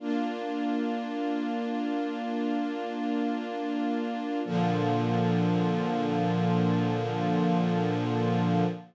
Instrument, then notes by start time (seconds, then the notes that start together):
string ensemble 1
0.00 A#3 D4 F4
4.45 A#2 D3 F3